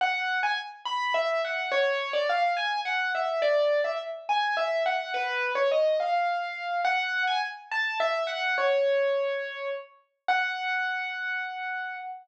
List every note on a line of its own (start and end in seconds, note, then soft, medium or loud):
0.01 0.38 F#5 loud
0.43 0.57 G#5 loud
0.85 1.12 B5 medium
1.14 1.42 E5 loud
1.45 1.69 F#5 medium
1.72 2.12 C#5 loud
2.13 2.27 D5 loud
2.29 2.53 F5 loud
2.57 2.80 G#5 loud
2.85 3.10 F#5 loud
3.15 3.43 E5 medium
3.42 3.81 D5 loud
3.84 3.98 E5 medium
4.29 4.55 G#5 medium
4.57 4.83 E5 medium
4.86 5.12 F#5 medium
5.14 5.51 B4 loud
5.55 5.69 C#5 medium
5.71 5.96 D#5 medium
6.00 6.81 F5 medium
6.85 7.22 F#5 loud
7.27 7.41 G#5 loud
7.71 7.98 A5 loud
8.00 8.23 E5 loud
8.27 8.55 F#5 loud
8.58 9.68 C#5 loud
10.28 11.96 F#5 loud